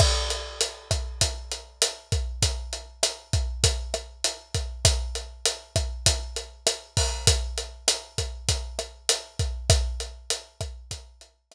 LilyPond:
\new DrumStaff \drummode { \time 4/4 \tempo 4 = 99 <cymc bd ss>8 hh8 hh8 <hh bd ss>8 <hh bd>8 hh8 <hh ss>8 <hh bd>8 | <hh bd>8 hh8 <hh ss>8 <hh bd>8 <hh bd>8 <hh ss>8 hh8 <hh bd>8 | <hh bd ss>8 hh8 hh8 <hh bd ss>8 <hh bd>8 hh8 <hh ss>8 <hho bd>8 | <hh bd>8 hh8 <hh ss>8 <hh bd>8 <hh bd>8 <hh ss>8 hh8 <hh bd>8 |
<hh bd ss>8 hh8 hh8 <hh bd ss>8 <hh bd>8 hh8 <hh ss>4 | }